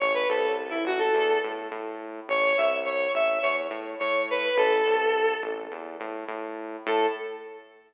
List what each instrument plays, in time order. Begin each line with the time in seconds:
0.00 synth bass 1 A1, lead 1 (square) C#5
0.14 lead 1 (square) B4
0.29 synth bass 1 C2, lead 1 (square) A4
0.70 lead 1 (square) E4
0.85 synth bass 1 A1, lead 1 (square) F#4
0.99 lead 1 (square) A4
1.15 synth bass 1 E2
1.44 synth bass 1 A2
1.71 synth bass 1 A2
2.28 synth bass 1 A1, lead 1 (square) C#5
2.57 synth bass 1 C2, lead 1 (square) E5
2.85 lead 1 (square) C#5
3.14 synth bass 1 A1, lead 1 (square) E5
3.42 synth bass 1 E2, lead 1 (square) C#5
3.70 synth bass 1 A2
3.99 synth bass 1 A2, lead 1 (square) C#5
4.30 lead 1 (square) B4
4.57 synth bass 1 A1, lead 1 (square) A4
4.86 synth bass 1 C2
5.43 synth bass 1 A1
5.72 synth bass 1 E2
6.00 synth bass 1 A2
6.28 synth bass 1 A2
6.86 synth bass 1 A2, lead 1 (square) A4